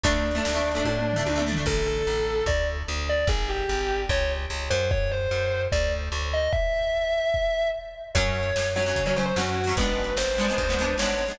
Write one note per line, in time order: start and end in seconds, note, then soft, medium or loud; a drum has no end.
0.04 0.40 D2 loud
0.04 0.29 A3 medium
0.04 1.42 D4 medium
0.04 0.29 D4 medium
0.04 kick medium
0.04 closed hi-hat loud
0.31 0.51 A3 medium
0.31 closed hi-hat medium
0.36 0.51 D4 medium
0.45 0.83 D2 medium
0.45 snare loud
0.54 0.70 A3 medium
0.54 0.70 D4 medium
0.72 1.07 A3 medium
0.72 closed hi-hat medium
0.76 1.07 D4 medium
0.85 1.22 A2 medium
0.85 kick medium
0.85 high tom medium
0.99 mid tom medium
1.13 1.32 A3 medium
1.13 floor tom medium
1.18 1.32 D4 medium
1.26 1.63 D2 medium
1.26 high tom medium
1.36 1.44 A3 medium
1.36 1.44 D4 medium
1.36 mid tom medium
1.47 1.55 A3 medium
1.47 1.55 D4 medium
1.53 1.65 A3 medium
1.53 floor tom loud
1.58 1.65 D4 medium
1.66 2.02 A1 loud
1.66 1.86 A4 medium
1.66 kick medium
1.66 crash medium
1.87 2.44 A4 medium
2.07 2.44 A1 medium
2.46 2.83 D2 loud
2.46 2.64 D5 medium
2.46 kick medium
2.88 3.25 D2 medium
3.09 3.26 D5 medium
3.27 3.64 G#1 loud
3.27 3.47 G#4 medium
3.27 kick loud
3.49 3.99 G4 medium
3.69 4.06 G#1 medium
4.09 4.46 C#2 loud
4.09 4.28 C#5 medium
4.09 kick medium
4.50 4.69 C#2 medium
4.70 5.27 F#2 loud
4.70 4.87 C5 medium
4.91 5.09 C#5 medium
4.91 kick loud
5.11 5.62 C5 medium
5.31 5.68 F#2 medium
5.72 6.09 D2 loud
5.72 5.89 D5 medium
5.72 kick medium
6.12 6.48 D2 loud
6.33 6.51 D#5 medium
6.53 7.67 E5 medium
6.53 kick loud
7.34 kick medium
8.15 8.52 F#2 loud
8.15 8.48 F#3 medium
8.15 8.48 C#4 medium
8.15 8.66 C#5 medium
8.15 kick medium
8.15 closed hi-hat medium
8.29 kick medium
8.43 closed hi-hat medium
8.56 8.93 F#2 medium
8.56 snare medium
8.76 8.84 F#3 medium
8.76 8.84 C#4 medium
8.76 9.02 C#5 medium
8.83 9.02 F#3 medium
8.83 closed hi-hat medium
8.87 9.02 C#4 medium
8.96 9.33 C#3 medium
8.96 kick medium
8.96 closed hi-hat loud
9.06 9.14 F#3 medium
9.06 9.14 C#4 medium
9.06 9.16 C#5 medium
9.16 9.33 F#3 medium
9.16 9.33 C#4 medium
9.16 9.25 C5 medium
9.23 9.35 C5 medium
9.23 closed hi-hat medium
9.36 9.73 F#2 medium
9.36 9.61 F#3 medium
9.36 9.61 C#4 medium
9.36 9.72 F#4 medium
9.36 snare loud
9.64 9.75 F#3 medium
9.64 open hi-hat medium
9.69 9.75 C#4 medium
9.77 10.13 G#1 medium
9.77 10.10 G#3 medium
9.77 10.10 B3 medium
9.77 10.10 D4 medium
9.77 10.13 B4 medium
9.77 kick loud
9.77 closed hi-hat loud
10.04 closed hi-hat medium
10.16 10.53 G#1 medium
10.16 10.93 C5 medium
10.16 snare loud
10.38 10.46 G#3 medium
10.38 10.46 B3 medium
10.38 10.46 D4 medium
10.45 10.64 G#3 medium
10.45 closed hi-hat medium
10.50 10.64 B3 medium
10.50 10.64 D4 medium
10.58 10.95 D2 medium
10.58 kick medium
10.58 closed hi-hat loud
10.69 10.77 G#3 medium
10.69 10.77 B3 medium
10.69 10.77 D4 medium
10.79 10.95 G#3 medium
10.79 10.95 B3 medium
10.79 10.95 D4 medium
10.85 closed hi-hat medium
10.98 11.34 G#1 medium
10.98 11.24 G#3 medium
10.98 11.24 B3 medium
10.98 11.37 C#5 medium
10.98 snare loud
11.03 11.24 D4 medium
11.26 11.36 G#3 medium
11.26 open hi-hat medium
11.30 11.36 B3 medium
11.30 11.36 D4 medium